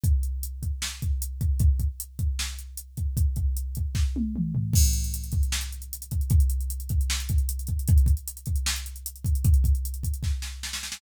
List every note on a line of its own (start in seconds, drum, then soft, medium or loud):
0.04 kick medium
0.04 closed hi-hat medium
0.23 closed hi-hat medium
0.43 closed hi-hat medium
0.63 kick medium
0.63 closed hi-hat medium
0.82 snare medium
1.02 kick medium
1.02 closed hi-hat medium
1.22 closed hi-hat medium
1.41 kick medium
1.41 closed hi-hat medium
1.60 kick medium
1.60 closed hi-hat medium
1.80 kick medium
1.80 closed hi-hat medium
2.00 closed hi-hat medium
2.19 kick medium
2.19 closed hi-hat medium
2.39 snare medium
2.59 closed hi-hat medium
2.77 closed hi-hat medium
2.97 kick medium
2.97 closed hi-hat medium
3.17 kick medium
3.17 closed hi-hat medium
3.36 kick medium
3.36 closed hi-hat medium
3.57 closed hi-hat medium
3.75 kick medium
3.75 closed hi-hat medium
3.95 kick medium
3.95 snare medium
4.16 high tom medium
4.36 mid tom medium
4.55 floor tom medium
4.73 kick medium
4.73 crash loud
4.84 closed hi-hat medium
4.93 closed hi-hat medium
5.04 closed hi-hat medium
5.14 closed hi-hat medium
5.24 closed hi-hat medium
5.32 kick medium
5.32 closed hi-hat medium
5.43 closed hi-hat medium
5.52 snare medium
5.61 closed hi-hat medium
5.72 closed hi-hat medium
5.82 closed hi-hat medium
5.93 closed hi-hat medium
6.02 closed hi-hat medium
6.11 kick medium
6.11 closed hi-hat medium
6.21 closed hi-hat medium
6.30 kick loud
6.30 closed hi-hat medium
6.40 closed hi-hat medium
6.50 closed hi-hat medium
6.61 closed hi-hat medium
6.70 closed hi-hat medium
6.80 closed hi-hat medium
6.89 kick medium
6.89 closed hi-hat medium
7.01 closed hi-hat medium
7.10 snare medium
7.20 closed hi-hat medium
7.29 kick medium
7.29 closed hi-hat medium
7.38 closed hi-hat medium
7.49 closed hi-hat loud
7.59 closed hi-hat medium
7.67 kick medium
7.67 closed hi-hat medium
7.79 closed hi-hat medium
7.88 kick loud
7.88 closed hi-hat medium
7.98 closed hi-hat medium
8.06 kick medium
8.06 closed hi-hat medium
8.17 closed hi-hat medium
8.28 closed hi-hat medium
8.37 closed hi-hat medium
8.46 kick medium
8.46 closed hi-hat medium
8.56 closed hi-hat medium
8.66 snare loud
8.76 closed hi-hat medium
8.86 closed hi-hat medium
8.96 closed hi-hat medium
9.06 closed hi-hat loud
9.16 closed hi-hat medium
9.25 kick medium
9.25 closed hi-hat medium
9.35 closed hi-hat medium
9.44 kick loud
9.44 closed hi-hat medium
9.54 closed hi-hat medium
9.64 kick medium
9.64 closed hi-hat medium
9.75 closed hi-hat medium
9.85 closed hi-hat medium
9.94 closed hi-hat medium
10.03 kick medium
10.03 closed hi-hat medium
10.14 closed hi-hat medium
10.23 kick medium
10.23 snare medium
10.42 snare medium
10.63 snare medium
10.73 snare medium
10.83 snare medium
10.92 snare medium